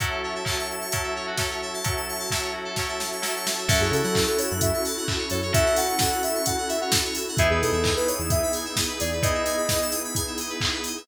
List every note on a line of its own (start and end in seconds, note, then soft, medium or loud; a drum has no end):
0.00 0.41 F#3 medium
0.00 0.41 C#4 medium
0.00 0.41 E4 medium
0.00 0.09 F#4 loud
0.00 3.65 F#4 medium
0.00 0.41 A4 medium
0.00 3.65 C#5 medium
0.00 3.65 E5 medium
0.00 3.65 A5 medium
0.00 kick medium
0.00 closed hi-hat medium
0.11 0.21 A4 medium
0.24 0.34 C#5 medium
0.35 0.46 E5 medium
0.45 0.86 F#3 medium
0.45 0.86 C#4 medium
0.45 0.86 E4 medium
0.45 0.86 A4 medium
0.45 0.57 A5 medium
0.45 kick medium
0.45 clap loud
0.59 0.69 C#6 medium
0.70 0.81 E6 medium
0.81 0.91 C#6 medium
0.91 1.34 F#3 medium
0.91 1.34 C#4 medium
0.91 1.34 E4 medium
0.91 1.34 A4 medium
0.91 1.02 A5 medium
0.91 kick medium
0.91 closed hi-hat loud
1.03 1.14 E5 medium
1.16 1.26 C#5 medium
1.27 1.37 F#4 medium
1.37 1.80 F#3 medium
1.37 1.80 C#4 medium
1.37 1.80 E4 medium
1.37 1.80 A4 medium
1.37 1.49 A4 medium
1.37 kick medium
1.37 snare medium
1.50 1.61 C#5 medium
1.62 1.73 E5 medium
1.74 1.84 A5 medium
1.84 2.26 F#3 medium
1.84 2.26 C#4 medium
1.84 2.26 E4 medium
1.84 2.26 A4 medium
1.84 1.94 C#6 medium
1.84 kick medium
1.84 closed hi-hat medium
1.96 2.07 E6 medium
2.08 2.19 C#6 medium
2.19 2.29 A5 medium
2.30 2.73 F#3 medium
2.30 2.73 C#4 medium
2.30 2.73 E4 medium
2.30 2.73 A4 medium
2.30 2.41 E5 medium
2.30 kick medium
2.30 snare medium
2.42 2.52 C#5 medium
2.53 2.64 F#4 medium
2.65 2.75 A4 medium
2.76 3.20 F#3 medium
2.76 3.20 C#4 medium
2.76 3.20 E4 medium
2.76 3.20 A4 medium
2.76 2.87 C#5 medium
2.76 kick medium
2.76 snare medium
2.89 2.99 E5 medium
2.99 3.10 A5 medium
2.99 snare medium
3.12 3.22 C#6 medium
3.22 3.64 F#3 medium
3.22 3.64 C#4 medium
3.22 3.64 E4 medium
3.22 3.64 A4 medium
3.22 3.34 E6 medium
3.22 snare medium
3.36 3.46 C#6 medium
3.45 3.56 A5 medium
3.45 snare loud
3.58 3.68 E5 medium
3.68 3.79 F#2 loud
3.68 5.35 C#4 medium
3.68 7.35 C#4 medium
3.68 5.35 E4 medium
3.68 7.35 E4 loud
3.68 5.35 F#4 medium
3.68 7.35 F#4 loud
3.68 5.35 A4 medium
3.68 3.79 A4 loud
3.68 7.35 A4 medium
3.68 3.80 E5 loud
3.68 kick loud
3.68 crash loud
3.80 3.91 F#2 loud
3.80 3.92 G#4 loud
3.80 3.92 C#5 medium
3.91 4.02 C#3 loud
3.91 4.21 A4 medium
3.91 4.03 E5 medium
3.91 open hi-hat medium
4.03 4.25 F#3 medium
4.03 4.14 F#5 loud
4.15 4.26 A5 loud
4.15 kick medium
4.15 clap loud
4.26 4.38 A4 loud
4.26 4.37 C#6 medium
4.38 4.49 C#5 loud
4.38 4.50 E6 medium
4.38 open hi-hat medium
4.50 4.72 F#2 loud
4.50 4.61 F#6 medium
4.61 4.81 E5 loud
4.61 4.71 E6 medium
4.61 kick medium
4.61 closed hi-hat loud
4.74 4.84 C#6 medium
4.85 4.96 A5 medium
4.85 open hi-hat medium
4.97 5.07 F#5 medium
5.08 5.18 E5 medium
5.08 kick medium
5.08 clap loud
5.18 5.29 C#5 medium
5.30 5.52 F#2 medium
5.30 5.40 A4 medium
5.30 5.51 C#5 loud
5.30 open hi-hat medium
5.42 5.53 C#5 medium
5.53 7.19 C#4 medium
5.53 7.19 E4 medium
5.53 7.19 F#4 medium
5.53 7.19 A4 medium
5.53 5.76 E5 loud
5.53 5.65 E5 loud
5.53 kick loud
5.53 closed hi-hat loud
5.66 5.76 F#5 medium
5.76 5.97 F#5 loud
5.76 5.87 A5 medium
5.76 open hi-hat medium
5.88 5.98 C#6 medium
5.99 6.22 F#5 loud
5.99 6.10 E6 medium
5.99 kick medium
5.99 snare loud
6.11 6.22 F#6 medium
6.23 6.43 E5 medium
6.23 6.34 E6 medium
6.23 open hi-hat medium
6.35 6.45 C#6 medium
6.45 6.65 F#5 loud
6.45 6.56 A5 medium
6.45 kick medium
6.45 closed hi-hat loud
6.57 6.68 F#5 medium
6.68 6.79 E5 medium
6.68 6.80 E5 loud
6.68 open hi-hat medium
6.81 6.92 C#5 medium
6.81 6.92 F#5 medium
6.92 7.02 A4 medium
6.92 kick medium
6.92 snare loud
7.05 7.15 C#5 medium
7.15 7.26 E5 medium
7.15 open hi-hat medium
7.28 7.38 F#5 medium
7.37 7.49 E2 medium
7.37 9.05 B3 medium
7.37 11.05 B3 loud
7.37 9.05 D#4 medium
7.37 11.05 D#4 loud
7.37 9.05 E4 medium
7.37 11.05 E4 medium
7.37 7.48 G#4 loud
7.37 9.05 G#4 medium
7.37 11.05 G#4 loud
7.37 7.49 E5 loud
7.37 kick loud
7.37 closed hi-hat loud
7.50 7.62 E2 loud
7.50 7.61 G#4 loud
7.50 7.61 B4 medium
7.62 7.73 B2 medium
7.62 7.91 A4 medium
7.62 7.72 D#5 medium
7.62 open hi-hat medium
7.72 7.93 E2 medium
7.72 7.83 E5 medium
7.84 7.94 G#5 medium
7.84 kick medium
7.84 clap loud
7.96 8.07 B4 medium
7.96 8.07 B5 medium
8.07 8.19 C#5 medium
8.07 8.18 D#6 medium
8.07 open hi-hat medium
8.18 8.40 E2 medium
8.18 8.29 E6 medium
8.30 8.51 E5 loud
8.30 8.41 D#6 medium
8.30 kick loud
8.30 closed hi-hat loud
8.43 8.53 B5 medium
8.53 8.64 G#5 medium
8.53 open hi-hat medium
8.65 8.75 E5 medium
8.76 8.87 D#5 loud
8.76 kick medium
8.76 snare loud
8.89 8.99 B4 medium
9.00 9.22 E2 medium
9.00 9.10 G#4 loud
9.00 9.22 D5 loud
9.00 open hi-hat medium
9.12 9.23 B4 medium
9.22 10.89 B3 medium
9.22 10.89 D#4 medium
9.22 10.89 E4 medium
9.22 10.89 G#4 medium
9.22 9.33 D#5 medium
9.22 9.87 D#5 loud
9.22 kick loud
9.22 closed hi-hat loud
9.34 9.45 E5 medium
9.46 9.56 G#5 medium
9.46 open hi-hat medium
9.57 9.68 B5 medium
9.69 9.79 D#6 medium
9.69 kick medium
9.69 snare loud
9.81 9.92 E6 medium
9.91 10.02 D#6 loud
9.91 open hi-hat medium
10.04 10.15 B5 medium
10.15 10.25 G#5 loud
10.15 kick medium
10.15 closed hi-hat loud
10.27 10.37 E5 medium
10.38 10.50 D#5 medium
10.38 open hi-hat medium
10.50 10.60 B4 medium
10.61 10.72 G#4 medium
10.61 kick medium
10.61 clap loud
10.73 10.84 B4 medium
10.84 10.96 D#5 medium
10.84 open hi-hat medium
10.97 11.07 E5 medium